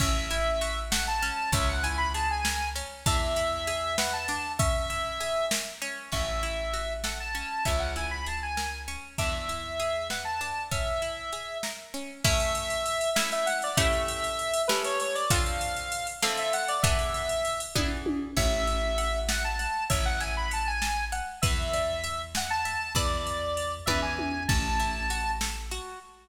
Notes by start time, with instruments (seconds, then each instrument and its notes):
0.00 electric bass (finger) A1, acoustic guitar (steel) C#4, lead 1 (square) E5, kick, crash
0.30 acoustic guitar (steel) E4, ride
0.61 acoustic guitar (steel) F#4, ride
0.91 acoustic guitar (steel) A4, lead 1 (square) F#5, snare
1.07 lead 1 (square) A5
1.22 acoustic guitar (steel) C#4, ride
1.52 electric bass (finger) C#2, acoustic guitar (steel) C#4, lead 1 (square) E5, kick, ride
1.69 lead 1 (square) F#5
1.83 acoustic guitar (steel) E4, lead 1 (square) G#5, ride
1.98 lead 1 (square) B5
2.14 acoustic guitar (steel) G#4, lead 1 (square) A5, ride
2.31 lead 1 (square) G#5
2.45 acoustic guitar (steel) A#4, snare
2.76 acoustic guitar (steel) C#4, ride
3.06 electric bass (finger) E2, acoustic guitar (steel) D4, lead 1 (square) E5, kick, ride
3.36 acoustic guitar (steel) E4, ride
3.67 acoustic guitar (steel) G#4, ride
3.98 acoustic guitar (steel) B4, lead 1 (square) F#5, snare
4.13 lead 1 (square) A5
4.28 acoustic guitar (steel) D4, ride
4.59 acoustic guitar (steel) C#4, lead 1 (square) E5, kick, ride
4.90 acoustic guitar (steel) E4, ride
5.20 acoustic guitar (steel) G#4, ride
5.51 acoustic guitar (steel) A#4, snare
5.82 acoustic guitar (steel) C#4, ride
6.12 electric bass (finger) A1, acoustic guitar (steel) C#4, lead 1 (square) E5, kick, crash
6.43 acoustic guitar (steel) E4, ride
6.73 acoustic guitar (steel) F#4, ride
7.04 acoustic guitar (steel) A4, lead 1 (square) F#5, snare
7.20 lead 1 (square) A5
7.35 acoustic guitar (steel) C#4, ride
7.65 electric bass (finger) C#2, acoustic guitar (steel) C#4, lead 1 (square) E5, kick, ride
7.79 lead 1 (square) F#5
7.96 acoustic guitar (steel) E4, lead 1 (square) G#5, ride
8.11 lead 1 (square) B5
8.26 acoustic guitar (steel) G#4, lead 1 (square) A5, ride
8.43 lead 1 (square) G#5
8.57 acoustic guitar (steel) A#4, snare
8.88 acoustic guitar (steel) C#4, ride
9.18 electric bass (finger) E2, acoustic guitar (steel) D4, lead 1 (square) E5, kick, ride
9.49 acoustic guitar (steel) E4, ride
9.80 acoustic guitar (steel) G#4, ride
10.10 acoustic guitar (steel) B4, lead 1 (square) F#5, snare
10.25 lead 1 (square) A5
10.41 acoustic guitar (steel) D4, ride
10.71 acoustic guitar (steel) C#4, lead 1 (square) E5, kick, ride
11.02 acoustic guitar (steel) E4, ride
11.33 acoustic guitar (steel) G#4, ride
11.63 acoustic guitar (steel) A#4, snare
11.94 acoustic guitar (steel) C#4, ride
12.24 acoustic guitar (steel) A3 C#4 E4, lead 1 (square) E5, kick, crash
12.40 ride
12.55 ride
12.70 ride
12.86 ride
13.01 ride
13.15 acoustic guitar (steel) A3 C#4 E4, lead 1 (square) E5, snare
13.32 lead 1 (square) E5, ride
13.46 lead 1 (square) F#5, ride
13.62 lead 1 (square) D5, ride
13.77 acoustic guitar (steel) A3 C#4 E4 G4, lead 1 (square) E5, kick, ride
13.93 ride
14.08 ride
14.24 ride
14.39 ride
14.54 ride
14.68 acoustic guitar (steel) A3 C#4 E4 G4, lead 1 (square) B4, snare
14.84 lead 1 (square) C#5, ride
15.00 lead 1 (square) C#5, ride
15.15 lead 1 (square) D5, ride
15.30 acoustic guitar (steel) D3 C4 F4 A4, lead 1 (square) F5, kick, ride
15.46 ride
15.61 ride
15.77 ride
15.92 ride
16.07 ride
16.22 acoustic guitar (steel) D3 C4 F4 A4, lead 1 (square) E5, snare
16.37 lead 1 (square) E5, ride
16.53 lead 1 (square) F#5, ride
16.68 lead 1 (square) D5, ride
16.83 acoustic guitar (steel) E3 B3 D4 G#4, lead 1 (square) E5, kick, ride
16.99 ride
17.14 ride
17.29 ride
17.45 ride
17.60 ride
17.75 acoustic guitar (steel) E3 B3 D4 G#4, kick, high tom
18.06 high tom
18.36 electric bass (finger) A1, acoustic guitar (steel) C#5, lead 1 (square) E5, kick, crash
18.67 acoustic guitar (steel) E5, ride
18.98 acoustic guitar (steel) F#5, ride
19.29 lead 1 (square) F#5, acoustic guitar (steel) A5, snare
19.44 lead 1 (square) A5
19.59 acoustic guitar (steel) F#5, ride
19.90 electric bass (finger) A1, acoustic guitar (steel) C#5, lead 1 (square) E5, kick, ride
20.05 lead 1 (square) F#5
20.20 acoustic guitar (steel) E5, lead 1 (square) G#5, ride
20.37 lead 1 (square) B5
20.51 acoustic guitar (steel) F#5, lead 1 (square) A5, ride
20.67 lead 1 (square) G#5
20.82 acoustic guitar (steel) A5, snare
21.12 acoustic guitar (steel) F#5, ride
21.42 electric bass (finger) E2, acoustic guitar (steel) B4, lead 1 (square) E5, kick, ride
21.73 acoustic guitar (steel) D5, ride
22.04 acoustic guitar (steel) E5, ride
22.35 lead 1 (square) F#5, acoustic guitar (steel) G#5, snare
22.50 lead 1 (square) A5
22.65 acoustic guitar (steel) E5, ride
22.95 electric bass (finger) E2, acoustic guitar (steel) B4 D5 E5 A5, lead 1 (square) D5, kick, ride
23.27 ride
23.57 ride
23.86 electric bass (finger) E2, acoustic guitar (steel) B4 D5 E5 G#5, lead 1 (square) E5, kick, high tom
24.02 lead 1 (square) G#5
24.19 high tom
24.48 electric bass (finger) A1, acoustic guitar (steel) C#4, lead 1 (square) A5, kick, crash
24.80 acoustic guitar (steel) E4, ride
25.10 acoustic guitar (steel) F#4, ride
25.41 acoustic guitar (steel) A4, snare
25.71 acoustic guitar (steel) F#4, ride